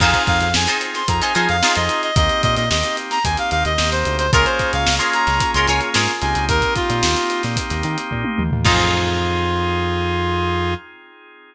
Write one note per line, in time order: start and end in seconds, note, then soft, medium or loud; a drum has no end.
0.00 0.13 F2 loud
0.00 0.49 C4 loud
0.00 0.49 D#4 loud
0.00 0.44 D#4 loud
0.00 0.49 F4 loud
0.00 0.44 F4 medium
0.00 0.49 G#4 loud
0.00 0.44 G#4 loud
0.00 0.44 C5 loud
0.00 0.22 F5 loud
0.00 kick loud
0.00 crash loud
0.13 kick medium
0.13 closed hi-hat medium
0.27 0.40 F2 medium
0.27 0.40 F5 loud
0.27 kick medium
0.27 closed hi-hat medium
0.41 0.54 F2 medium
0.41 0.53 F5 medium
0.41 closed hi-hat medium
0.54 0.67 F2 medium
0.54 1.03 C4 medium
0.54 1.03 D#4 loud
0.54 1.03 F4 medium
0.54 1.03 G#4 medium
0.54 0.78 G#5 medium
0.54 snare loud
0.67 1.11 D#4 medium
0.67 1.11 F4 medium
0.67 1.11 G#4 medium
0.67 1.11 C5 medium
0.67 closed hi-hat medium
0.81 closed hi-hat medium
0.94 1.07 C6 medium
0.94 snare medium
0.94 closed hi-hat medium
1.08 1.21 F2 medium
1.08 1.57 C4 medium
1.08 1.57 D#4 medium
1.08 1.57 F4 medium
1.08 1.57 G#4 medium
1.08 1.21 A#5 medium
1.08 kick medium
1.08 closed hi-hat loud
1.21 1.32 D#4 medium
1.21 1.32 F4 medium
1.21 1.32 G#4 medium
1.21 1.32 C5 medium
1.21 1.34 G#5 medium
1.21 closed hi-hat medium
1.35 1.48 F3 medium
1.35 1.56 D#4 medium
1.35 1.56 F4 medium
1.35 1.56 G#4 medium
1.35 1.56 C5 medium
1.35 1.48 G#5 medium
1.35 closed hi-hat medium
1.49 1.62 F2 medium
1.49 1.75 F5 loud
1.49 closed hi-hat medium
1.62 2.11 C4 medium
1.62 2.11 D#4 medium
1.62 2.06 D#4 medium
1.62 2.11 F4 loud
1.62 2.06 F4 medium
1.62 2.11 G#4 loud
1.62 2.06 G#4 medium
1.62 2.06 C5 medium
1.62 snare loud
1.75 1.89 F2 medium
1.75 2.02 D#5 medium
1.75 snare soft
1.75 closed hi-hat medium
1.89 closed hi-hat medium
2.03 2.15 D#5 medium
2.03 closed hi-hat medium
2.16 2.29 D#2 medium
2.16 2.65 A#3 loud
2.16 2.65 C4 loud
2.16 2.65 D#4 loud
2.16 2.65 G4 loud
2.16 2.42 D#5 loud
2.16 kick loud
2.16 closed hi-hat loud
2.29 closed hi-hat medium
2.42 2.56 A#2 medium
2.42 2.55 D#5 loud
2.42 kick medium
2.42 closed hi-hat medium
2.56 2.69 A#2 medium
2.56 2.69 D#5 medium
2.56 snare soft
2.56 closed hi-hat medium
2.70 2.83 D#2 medium
2.70 3.19 A#3 medium
2.70 3.19 C4 loud
2.70 3.19 D#4 medium
2.70 3.19 G4 loud
2.70 2.96 D#5 medium
2.70 snare loud
2.83 closed hi-hat medium
2.97 closed hi-hat medium
3.11 3.24 A#5 loud
3.11 snare medium
3.11 closed hi-hat medium
3.24 3.37 D#2 medium
3.24 3.73 A#3 medium
3.24 3.73 C4 medium
3.24 3.73 D#4 medium
3.24 3.73 G4 loud
3.24 3.37 G#5 medium
3.24 kick medium
3.24 closed hi-hat loud
3.37 3.50 F5 medium
3.37 closed hi-hat medium
3.51 3.64 D#2 medium
3.51 3.64 F5 loud
3.51 closed hi-hat medium
3.65 3.78 D#2 medium
3.65 3.90 D#5 medium
3.65 snare soft
3.65 closed hi-hat medium
3.78 4.04 D#2 medium
3.78 4.27 A#3 loud
3.78 4.27 C4 medium
3.78 4.27 D#4 loud
3.78 4.27 G4 loud
3.78 snare loud
3.91 4.17 C5 medium
3.91 snare soft
3.91 closed hi-hat medium
4.05 4.31 D2 medium
4.05 closed hi-hat medium
4.18 4.31 C5 loud
4.18 closed hi-hat medium
4.33 4.45 C#2 medium
4.33 6.13 A#3 loud
4.33 6.13 C#4 loud
4.33 6.13 F4 loud
4.33 4.76 F4 loud
4.33 6.13 G#4 loud
4.33 4.76 G#4 medium
4.33 4.45 A#4 loud
4.33 4.76 A#4 loud
4.33 4.76 C#5 medium
4.33 kick loud
4.33 closed hi-hat loud
4.45 4.71 C5 medium
4.45 closed hi-hat medium
4.59 kick medium
4.59 snare soft
4.59 closed hi-hat medium
4.73 4.86 C#2 medium
4.73 4.95 F5 loud
4.73 closed hi-hat medium
4.86 5.00 C#2 medium
4.86 snare loud
4.99 5.42 F4 medium
4.99 5.42 G#4 medium
4.99 5.42 A#4 medium
4.99 5.42 C#5 medium
4.99 snare soft
4.99 closed hi-hat medium
5.13 5.51 A#5 loud
5.13 closed hi-hat medium
5.27 5.40 C#2 medium
5.27 snare medium
5.27 closed hi-hat medium
5.40 kick medium
5.40 closed hi-hat loud
5.54 5.67 C#2 medium
5.54 5.67 F4 medium
5.54 5.67 G#4 medium
5.54 5.67 A#4 medium
5.54 5.67 C#5 medium
5.54 5.67 C6 loud
5.54 closed hi-hat medium
5.67 5.81 C#2 medium
5.67 5.90 F4 medium
5.67 5.90 G#4 medium
5.67 5.90 A#4 medium
5.67 5.90 C#5 medium
5.67 5.80 G#5 loud
5.67 closed hi-hat medium
5.81 closed hi-hat medium
5.94 6.08 G#2 medium
5.94 6.38 F4 medium
5.94 6.38 G#4 medium
5.94 6.38 A#4 medium
5.94 6.38 C#5 medium
5.94 snare loud
6.08 closed hi-hat medium
6.21 6.34 C#2 medium
6.21 8.43 A#3 loud
6.21 8.43 C4 loud
6.21 8.43 D#4 loud
6.21 8.43 G4 loud
6.21 6.45 G#5 medium
6.21 snare soft
6.21 closed hi-hat medium
6.35 6.48 C#2 medium
6.35 snare soft
6.35 closed hi-hat medium
6.49 6.61 D#2 medium
6.49 6.74 A#4 loud
6.49 kick loud
6.49 closed hi-hat loud
6.62 kick medium
6.62 closed hi-hat medium
6.75 7.42 F4 loud
6.75 kick medium
6.75 closed hi-hat medium
6.90 7.02 A#2 medium
6.90 closed hi-hat medium
7.03 7.15 D#2 medium
7.03 snare loud
7.16 snare soft
7.16 closed hi-hat medium
7.30 closed hi-hat medium
7.43 7.56 A#2 medium
7.43 snare medium
7.43 closed hi-hat medium
7.57 kick medium
7.57 closed hi-hat loud
7.70 7.83 D#2 medium
7.70 snare soft
7.70 closed hi-hat medium
7.83 7.97 D#3 medium
7.83 closed hi-hat medium
7.98 closed hi-hat medium
8.11 8.24 A#2 medium
8.11 kick medium
8.24 high tom medium
8.38 8.51 D#2 medium
8.38 mid tom medium
8.51 8.64 D#2 medium
8.51 floor tom loud
8.65 10.75 F2 loud
8.65 10.74 C4 loud
8.65 10.74 D#4 loud
8.65 10.74 F4 loud
8.65 10.74 G#4 loud
8.65 10.74 G#4 medium
8.65 10.74 C5 loud
8.65 kick loud
8.65 crash loud